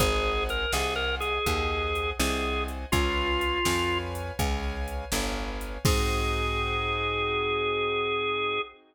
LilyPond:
<<
  \new Staff \with { instrumentName = "Drawbar Organ" } { \time 12/8 \key aes \major \tempo 4. = 82 aes'4 bes'8 aes'8 bes'8 aes'2 aes'4 r8 | f'2~ f'8 r2. r8 | aes'1. | }
  \new Staff \with { instrumentName = "Acoustic Grand Piano" } { \time 12/8 \key aes \major <c'' ees'' ges'' aes''>4. <c'' ees'' ges'' aes''>4. <c'' ees'' ges'' aes''>4. <c'' ees'' ges'' aes''>4. | <ces'' des'' f'' aes''>4. <ces'' des'' f'' aes''>4. <ces'' des'' f'' aes''>4. <ces'' des'' f'' aes''>4. | <c' ees' ges' aes'>1. | }
  \new Staff \with { instrumentName = "Electric Bass (finger)" } { \clef bass \time 12/8 \key aes \major aes,,4. c,4. ees,4. c,4. | des,4. f,4. des,4. g,,4. | aes,1. | }
  \new DrumStaff \with { instrumentName = "Drums" } \drummode { \time 12/8 <hh bd>4 hh8 sn4 hh8 <hh bd>4 hh8 sn4 hh8 | <hh bd>4 hh8 sn4 hh8 <hh bd>4 hh8 sn4 hh8 | <cymc bd>4. r4. r4. r4. | }
>>